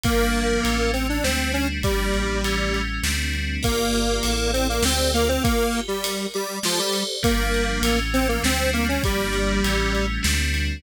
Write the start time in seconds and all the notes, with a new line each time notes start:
0.04 G1 F3 G3 A#3 D4, kick, ride
0.33 ride
0.63 A1 E3 A3 C#4, ride
0.93 C4, ride
1.09 D4
1.24 D2 G3 A3 C4 D4, snare
1.53 C#4, ride
1.82 G1 F3 G3 A#3 D4, kick, ride
2.14 A1, ride
2.44 E3 G3 A3 C#4, ride
2.74 ride
3.03 D2 G3 A3 C4 D4, snare
3.33 ride
3.63 G1 A#3 F4 G4 A#4 D5, kick, ride
3.94 ride
4.23 A1 E4 A4 D5, ride
4.53 C4, ride
4.69 A#3
4.83 D2 C4 G4 A4 C5 D5, snare
5.14 A#3 F4, ride
5.29 C4
5.44 A#3, kick, ride
5.73 G4, ride
5.88 G3
6.04 A#4, ride
6.34 G3 D5, ride
6.63 F3 G4 A4 C5 D5, snare
6.79 G3
6.94 ride
7.23 G1 F3 G3 A#3 D4, kick, ride
7.54 ride
7.82 A1 E3 A3 C#4, ride
8.14 C4, ride
8.29 A#3
8.43 D2 G3 A3 C4 D4, snare
8.73 A#3, ride
8.88 C#4
9.04 G1 F3 G3 A#3 D4, kick, ride
9.33 ride
9.64 A1 E3 G3 A3 C#4, ride
9.95 ride
10.23 D2 G3 A3 C4 D4, snare
10.54 ride